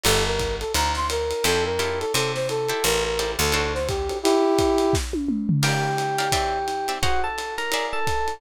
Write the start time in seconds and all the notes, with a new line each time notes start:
0.04 G1 F4 G4 A4 A#4, crash, ride
0.26 A#4
0.39 kick, hi-hat pedal, ride
0.60 A4, ride
0.74 D2 A#5, ride
0.95 C6, snare
1.10 A#4, hi-hat pedal, ride
1.31 ride
1.44 F2 E4 F4 G4 A4, ride
1.65 A#4
1.79 E4 F4 G4 A4, hi-hat pedal, ride
2.00 A4, ride
2.14 C3 A4, ride
2.35 C5, snare
2.49 A4, hi-hat pedal, ride
2.69 E4 G4 A4 C5, ride
2.84 A1 A#4, ride
3.04 A#4
3.19 E4 G4 A4 C5, hi-hat pedal, ride
3.39 D2 A4, ride
3.52 D4 F#4 A4 C5, ride
3.74 C5, snare
3.88 G4, kick, hi-hat pedal, ride
4.09 D4 F#4 A4 C5, ride
4.23 E4 G4, ride
4.58 kick, hi-hat pedal, ride
4.78 ride
4.93 kick, snare
5.13 high tom
5.28 mid tom
5.49 floor tom
5.63 G4 A#4 D5 F5 G5, crash, ride
5.98 hi-hat pedal, ride
6.18 G4 A#4 D5 F5, ride
6.32 C4 D5 E5 G5, kick, ride
6.68 hi-hat pedal, ride
6.88 C4 D5 E5 G5, ride
7.03 F#4 G#4 C5 F#5 A#5, kick, ride
7.24 A4 A5
7.38 hi-hat pedal, ride
7.58 A#4 A#5, ride
7.72 G#4 D5 E5 F5, ride
7.93 A4 A5
8.07 kick, hi-hat pedal, ride
8.28 ride